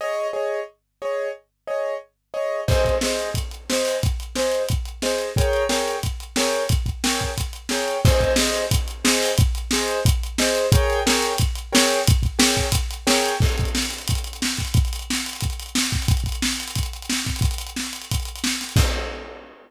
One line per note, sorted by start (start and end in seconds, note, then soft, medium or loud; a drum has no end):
0.01 0.28 G#4 medium
0.01 0.28 C#5 medium
0.01 0.28 D#5 medium
0.33 0.60 G#4 medium
0.33 0.60 C#5 medium
0.33 0.60 D#5 medium
1.02 1.29 G#4 medium
1.02 1.29 C#5 medium
1.02 1.29 D#5 medium
1.67 1.94 G#4 medium
1.67 1.94 C#5 medium
1.67 1.94 D#5 medium
2.34 2.61 G#4 medium
2.34 2.61 C#5 medium
2.34 2.61 D#5 medium
2.68 2.95 G#4 medium
2.68 2.95 C5 medium
2.68 2.95 D#5 medium
2.68 kick medium
2.68 crash medium
2.85 kick medium
2.85 closed hi-hat medium
3.01 3.30 G#4 medium
3.01 3.30 C5 medium
3.01 3.30 D#5 medium
3.01 snare medium
3.19 closed hi-hat medium
3.34 kick medium
3.34 closed hi-hat medium
3.51 closed hi-hat medium
3.70 3.97 G#4 medium
3.70 3.97 C5 medium
3.70 3.97 D#5 medium
3.70 snare medium
3.85 open hi-hat medium
4.03 kick medium
4.03 closed hi-hat medium
4.20 closed hi-hat medium
4.35 4.63 G#4 medium
4.35 4.63 C5 medium
4.35 4.63 D#5 medium
4.35 snare medium
4.52 closed hi-hat medium
4.69 kick medium
4.69 closed hi-hat medium
4.85 closed hi-hat medium
5.02 5.30 G#4 medium
5.02 5.30 C5 medium
5.02 5.30 D#5 medium
5.02 snare medium
5.18 closed hi-hat medium
5.36 5.64 G#4 medium
5.36 5.64 A#4 medium
5.36 5.64 C#5 medium
5.36 5.64 G5 medium
5.36 kick medium
5.36 closed hi-hat medium
5.53 closed hi-hat medium
5.69 5.96 G#4 medium
5.69 5.96 A#4 medium
5.69 5.96 C#5 medium
5.69 5.96 G5 medium
5.69 snare medium
5.88 closed hi-hat medium
6.03 kick medium
6.03 closed hi-hat medium
6.20 closed hi-hat medium
6.36 6.64 G#4 medium
6.36 6.64 A#4 medium
6.36 6.64 C#5 medium
6.36 6.64 G5 medium
6.36 snare loud
6.53 closed hi-hat medium
6.69 kick medium
6.69 closed hi-hat medium
6.86 kick medium
6.86 closed hi-hat medium
7.04 7.31 G#4 medium
7.04 7.31 A#4 medium
7.04 7.31 C#5 medium
7.04 7.31 G5 medium
7.04 snare loud
7.20 kick medium
7.20 closed hi-hat medium
7.38 kick medium
7.38 closed hi-hat medium
7.53 closed hi-hat medium
7.69 7.97 G#4 medium
7.69 7.97 A#4 medium
7.69 7.97 C#5 medium
7.69 7.97 G5 medium
7.69 snare medium
7.88 closed hi-hat medium
8.05 8.32 G#4 loud
8.05 8.32 C5 loud
8.05 8.32 D#5 loud
8.05 kick loud
8.05 crash loud
8.21 kick medium
8.21 closed hi-hat medium
8.36 8.64 G#4 medium
8.36 8.64 C5 medium
8.36 8.64 D#5 medium
8.36 snare loud
8.54 closed hi-hat medium
8.71 kick medium
8.71 closed hi-hat loud
8.88 closed hi-hat medium
9.04 9.31 G#4 medium
9.04 9.31 C5 medium
9.04 9.31 D#5 medium
9.04 snare loud
9.23 open hi-hat medium
9.38 kick loud
9.38 closed hi-hat loud
9.55 closed hi-hat medium
9.71 10.00 G#4 medium
9.71 10.00 C5 medium
9.71 10.00 D#5 medium
9.71 snare loud
9.88 closed hi-hat medium
10.05 kick loud
10.05 closed hi-hat loud
10.23 closed hi-hat medium
10.38 10.66 G#4 medium
10.38 10.66 C5 medium
10.38 10.66 D#5 medium
10.38 snare loud
10.55 closed hi-hat medium
10.72 11.00 G#4 loud
10.72 11.00 A#4 medium
10.72 11.00 C#5 loud
10.72 11.00 G5 loud
10.72 kick loud
10.72 closed hi-hat loud
10.90 closed hi-hat medium
11.06 11.33 G#4 medium
11.06 11.33 A#4 medium
11.06 11.33 C#5 medium
11.06 11.33 G5 medium
11.06 snare loud
11.22 closed hi-hat medium
11.38 kick medium
11.38 closed hi-hat loud
11.55 closed hi-hat medium
11.72 11.99 G#4 medium
11.72 11.99 A#4 medium
11.72 11.99 C#5 medium
11.72 11.99 G5 medium
11.72 snare loud
11.91 closed hi-hat medium
12.07 kick loud
12.07 closed hi-hat loud
12.23 kick medium
12.23 closed hi-hat medium
12.39 12.66 G#4 medium
12.39 12.66 A#4 medium
12.39 12.66 C#5 medium
12.39 12.66 G5 medium
12.39 snare loud
12.57 kick medium
12.57 closed hi-hat medium
12.72 kick medium
12.72 closed hi-hat loud
12.91 closed hi-hat medium
13.07 13.34 G#4 medium
13.07 13.34 A#4 medium
13.07 13.34 C#5 medium
13.07 13.34 G5 medium
13.07 snare loud
13.26 closed hi-hat medium
13.40 kick loud
13.40 crash medium
13.49 closed hi-hat medium
13.58 kick medium
13.58 closed hi-hat medium
13.65 closed hi-hat medium
13.75 snare medium
13.82 closed hi-hat medium
13.90 snare soft
13.90 closed hi-hat medium
13.98 closed hi-hat medium
14.08 kick medium
14.08 closed hi-hat loud
14.15 closed hi-hat medium
14.24 closed hi-hat medium
14.33 closed hi-hat medium
14.42 snare medium
14.48 closed hi-hat medium
14.57 kick medium
14.57 snare soft
14.57 closed hi-hat medium
14.65 closed hi-hat medium
14.74 kick loud
14.74 closed hi-hat medium
14.85 closed hi-hat medium
14.93 closed hi-hat medium
14.99 closed hi-hat medium
15.10 snare medium
15.15 closed hi-hat medium
15.26 closed hi-hat medium
15.33 closed hi-hat medium
15.41 kick medium
15.41 closed hi-hat medium
15.50 closed hi-hat medium
15.59 closed hi-hat medium
15.66 closed hi-hat medium
15.75 snare loud
15.83 closed hi-hat medium
15.91 kick medium
15.91 snare medium
15.91 closed hi-hat medium
16.02 closed hi-hat medium
16.08 kick loud
16.08 closed hi-hat medium
16.17 closed hi-hat medium
16.24 kick medium
16.24 closed hi-hat medium
16.32 closed hi-hat medium
16.42 snare loud
16.53 closed hi-hat medium
16.60 closed hi-hat medium
16.68 closed hi-hat medium
16.75 kick medium
16.75 closed hi-hat medium
16.83 closed hi-hat medium
16.93 closed hi-hat medium
17.02 closed hi-hat medium
17.09 snare medium
17.17 closed hi-hat medium
17.25 kick medium
17.25 snare medium
17.25 closed hi-hat medium
17.36 closed hi-hat medium
17.41 kick medium
17.41 closed hi-hat medium
17.51 closed hi-hat medium
17.58 closed hi-hat medium
17.67 closed hi-hat medium
17.76 snare medium
17.83 closed hi-hat medium
17.93 closed hi-hat medium
18.02 closed hi-hat medium
18.11 kick medium
18.11 closed hi-hat medium
18.20 closed hi-hat medium
18.25 closed hi-hat medium
18.36 closed hi-hat medium
18.44 snare loud
18.50 closed hi-hat medium
18.61 snare soft
18.61 closed hi-hat medium
18.69 closed hi-hat medium
18.76 kick loud
18.76 crash loud